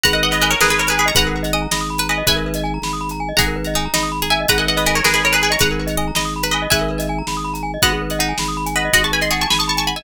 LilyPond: <<
  \new Staff \with { instrumentName = "Pizzicato Strings" } { \time 6/8 \key gis \phrygian \tempo 4. = 108 <fis'' ais''>16 <dis'' fis''>16 <dis'' fis''>16 <b' dis''>16 <b' dis''>16 <ais' cis''>16 <gis' b'>16 <gis' b'>16 <ais' cis''>16 <gis' b'>16 <gis' b'>16 <ais'' cis'''>16 | <fis'' ais''>2~ <fis'' ais''>8 <b' dis''>8 | <e'' gis''>2. | <fis'' ais''>2~ <fis'' ais''>8 <e'' gis''>8 |
<fis'' ais''>16 <dis'' fis''>16 <dis'' fis''>16 <b' dis''>16 <b' dis''>16 <ais' cis''>16 <gis' b'>16 <gis' b'>16 <ais' cis''>16 <gis' b'>16 <gis' b'>16 <ais'' cis'''>16 | <fis'' ais''>2~ <fis'' ais''>8 <b' dis''>8 | <e'' gis''>2. | <dis'' fis''>2~ <dis'' fis''>8 <b' dis''>8 |
<dis'' fis''>16 <a'' cis'''>16 <gis'' b''>16 bis''16 <a'' cis'''>16 <a'' cis'''>16 <gis'' b''>16 <a'' cis'''>16 <a'' cis'''>16 <a'' cis'''>16 <gis'' b''>16 <e'' gis''>16 | }
  \new Staff \with { instrumentName = "Pizzicato Strings" } { \time 6/8 \key gis \phrygian b'4 ais'8 ais'8 r16 b'16 r8 | b'4 dis''8 dis''8 r16 b'16 r8 | b'2~ b'8 r8 | gis'4 dis'8 dis'8 r16 gis'16 r8 |
b'4 ais'8 ais'8 r16 b'16 r8 | b'4 dis''8 dis''8 r16 b'16 r8 | b'2~ b'8 r8 | b4 dis'4 r4 |
fis'4 gis'4 r4 | }
  \new Staff \with { instrumentName = "Glockenspiel" } { \time 6/8 \key gis \phrygian gis'16 ais'16 b'16 dis''16 gis''16 ais''16 b''16 dis'''16 b''16 ais''16 gis''16 dis''16 | gis'16 ais'16 b'16 dis''16 gis''16 ais''16 b''16 dis'''16 b''16 ais''16 gis''16 dis''16 | gis'16 ais'16 b'16 dis''16 gis''16 ais''16 b''16 dis'''16 b''16 ais''16 gis''16 dis''16 | gis'16 ais'16 b'16 dis''16 gis''16 ais''16 b''16 dis'''16 b''16 ais''16 gis''16 dis''16 |
gis'16 ais'16 b'16 dis''16 gis''16 ais''16 b''16 dis'''16 b''16 ais''16 gis''16 dis''16 | gis'16 ais'16 b'16 dis''16 gis''16 ais''16 b''16 dis'''16 b''16 ais''16 gis''16 dis''16 | gis'16 ais'16 b'16 dis''16 gis''16 ais''16 b''16 dis'''16 b''16 ais''16 gis''16 dis''16 | fis'16 gis'16 b'16 dis''16 fis''16 gis''16 b''16 dis'''16 b''16 gis''16 fis''16 dis''16 |
fis'16 gis'16 b'16 dis''16 fis''16 gis''16 b''16 dis'''16 b''16 gis''16 fis''16 dis''16 | }
  \new Staff \with { instrumentName = "Drawbar Organ" } { \clef bass \time 6/8 \key gis \phrygian gis,,4. gis,,4. | gis,,4. gis,,4. | gis,,4. gis,,4. | gis,,4. gis,,4. |
gis,,4. gis,,4. | gis,,4. gis,,4. | gis,,4. gis,,4. | gis,,4. gis,,4. |
gis,,4. gis,,4. | }
  \new DrumStaff \with { instrumentName = "Drums" } \drummode { \time 6/8 <hh bd>8. hh8. sn8. hh8. | <hh bd>8. hh8. sn8. hh8. | <hh bd>8. hh8. sn8. hh8. | <hh bd>8. hh8. sn8. hh8. |
<hh bd>8. hh8. sn8. hh8. | <hh bd>8. hh8. sn8. hh8. | <hh bd>8. hh8. sn8. hh8. | <hh bd>8. hh8. sn8. hh8. |
<hh bd>8. hh8. sn8. hh8. | }
>>